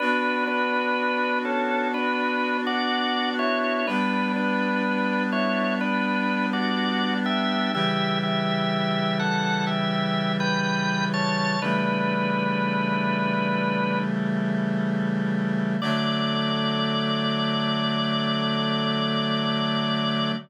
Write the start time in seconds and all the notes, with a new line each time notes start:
0.00 B3 D4 F#4 B4
0.47 D4 B4
1.45 C#4 A4
1.94 D4 B4
2.67 F#4 D5
3.39 E4 C#5
3.87 G3 B3 D4 B4
4.36 D4 B4
5.32 E4 C#5
5.81 D4 B4
6.53 F#4 D5
7.26 G4 E5
7.73 C#3 E3 G3 G4 E5
8.23 G4 E5
9.19 A4 F#5
9.67 G4 E5
10.40 B4 G5
11.14 C#5 A5
11.61 C#3 E3 G3 A3 D4 B4
15.81 D3 F#3 A3 D5